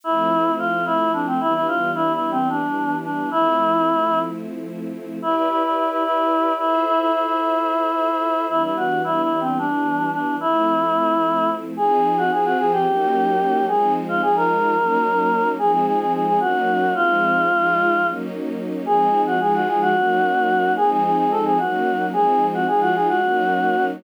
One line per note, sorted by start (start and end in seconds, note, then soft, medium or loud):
0.04 1.39 F3 medium
0.04 1.39 A3 medium
0.04 1.39 C4 medium
0.04 1.39 E4 medium
0.04 0.52 E4 medium
0.59 0.84 F4 medium
0.86 1.12 E4 medium
1.13 1.26 D4 medium
1.27 1.40 C4 medium
1.40 3.29 E3 medium
1.40 3.29 G3 medium
1.40 3.29 B3 medium
1.40 3.29 D4 medium
1.40 1.53 E4 medium
1.54 1.67 E4 medium
1.68 1.91 F4 medium
1.95 2.12 E4 medium
2.13 2.30 E4 medium
2.31 2.48 C4 medium
2.49 2.95 D4 medium
3.04 3.29 D4 medium
3.30 5.19 F3 medium
3.30 5.19 A3 medium
3.30 5.19 C4 medium
3.30 5.19 E4 medium
3.30 4.19 E4 medium
5.22 5.35 E4 medium
5.22 6.59 E4 medium
5.22 6.59 G4 medium
5.22 6.59 B4 medium
5.22 6.59 D5 medium
5.36 5.49 E4 medium
5.49 5.62 E4 medium
5.63 5.76 E4 medium
5.77 5.90 E4 medium
5.90 6.03 E4 medium
6.04 6.53 E4 medium
6.59 6.84 E4 medium
6.59 8.48 F4 medium
6.59 8.48 A4 medium
6.59 8.48 C5 medium
6.59 8.48 E5 medium
6.86 6.99 E4 medium
6.99 7.12 E4 medium
7.13 7.26 E4 medium
7.27 8.45 E4 medium
8.48 10.37 E3 medium
8.48 10.37 G3 medium
8.48 10.37 B3 medium
8.48 10.37 D4 medium
8.48 8.62 E4 medium
8.63 8.76 E4 medium
8.77 9.01 F#4 medium
9.04 9.21 E4 medium
9.22 9.39 E4 medium
9.40 9.58 C4 medium
9.59 10.10 D4 medium
10.13 10.35 D4 medium
10.40 11.76 F3 medium
10.40 11.76 A3 medium
10.40 11.76 C4 medium
10.40 11.50 E4 medium
10.40 11.76 E4 medium
11.77 12.31 F3 medium
11.77 12.31 C4 medium
11.77 12.31 D#4 loud
11.77 12.16 G#4 medium
11.77 12.31 G#4 medium
12.18 12.31 F#4 medium
12.31 12.85 F3 loud
12.31 12.85 C4 medium
12.31 12.85 F4 medium
12.31 12.85 G#4 medium
12.31 12.44 G#4 medium
12.45 12.58 F#4 medium
12.59 12.72 G#4 medium
12.72 13.65 G4 medium
12.86 13.67 F#3 medium
12.86 13.67 A#3 medium
12.86 13.67 C#4 medium
12.86 13.67 D#4 medium
13.67 14.21 F3 medium
13.67 14.21 G#3 medium
13.67 14.21 C4 medium
13.67 14.21 D#4 medium
13.67 13.93 G#4 medium
14.09 14.21 F4 medium
14.22 14.76 F3 medium
14.22 14.76 G#3 medium
14.22 14.75 D#4 medium
14.22 14.76 F4 medium
14.22 14.35 G#4 medium
14.36 15.48 A#4 medium
14.76 15.57 F#3 medium
14.76 15.57 A#3 loud
14.76 15.57 C#4 medium
14.76 15.57 D#4 medium
15.58 16.39 F3 medium
15.58 16.39 G#3 medium
15.58 16.39 C4 medium
15.58 16.39 D#4 medium
15.58 15.72 G#4 medium
15.72 15.85 G#4 medium
15.86 15.99 G#4 medium
15.99 16.12 G#4 medium
16.13 16.26 G#4 medium
16.27 16.40 G#4 medium
16.40 16.94 F#3 medium
16.40 16.94 A#3 medium
16.40 16.94 C#4 medium
16.40 16.94 D#4 medium
16.40 16.94 F#4 medium
16.95 17.49 F3 medium
16.95 17.49 G#3 medium
16.95 17.49 C4 medium
16.95 17.49 D#4 medium
16.95 18.07 F4 medium
17.50 18.04 F3 medium
17.50 18.04 G#3 medium
17.50 18.04 D#4 medium
17.50 18.04 F4 loud
18.05 18.86 F#3 medium
18.05 18.86 A#3 medium
18.05 18.86 C#4 medium
18.05 18.84 D#4 medium
18.85 19.39 F3 medium
18.85 19.39 G#3 medium
18.85 19.39 C4 medium
18.85 19.39 D#4 loud
18.85 19.22 G#4 medium
19.27 19.40 F#4 medium
19.39 19.93 F3 medium
19.39 19.93 G#3 loud
19.39 19.93 D#4 medium
19.39 19.93 F4 medium
19.39 19.53 G#4 medium
19.54 19.67 F#4 medium
19.68 19.81 G#4 medium
19.81 20.73 F#4 medium
19.95 20.76 F#3 medium
19.95 20.76 A#3 medium
19.95 20.76 C#4 medium
19.95 20.76 D#4 medium
20.77 21.59 F3 medium
20.77 21.59 G#3 medium
20.77 21.59 C4 medium
20.77 21.59 D#4 loud
20.77 20.90 G#4 medium
20.90 21.03 G#4 medium
21.04 21.17 G#4 medium
21.18 21.30 G#4 medium
21.31 21.44 A4 medium
21.45 21.58 G#4 medium
21.58 22.14 F#3 medium
21.58 22.14 A#3 medium
21.58 22.14 C#4 medium
21.58 22.11 D#4 medium
21.58 22.06 F#4 medium
22.12 22.66 F3 loud
22.12 22.66 G#3 medium
22.12 22.66 C4 medium
22.12 22.66 D#4 medium
22.12 22.46 G#4 medium
22.54 22.67 F#4 medium
22.67 23.21 F3 medium
22.67 23.21 G#3 medium
22.67 23.21 D#4 medium
22.67 23.21 F4 loud
22.67 22.80 G#4 medium
22.81 22.94 F#4 medium
22.95 23.08 G#4 medium
23.09 23.85 F#4 medium
23.22 24.03 F#3 medium
23.22 24.03 A#3 medium
23.22 24.03 C#4 medium
23.22 24.03 D#4 medium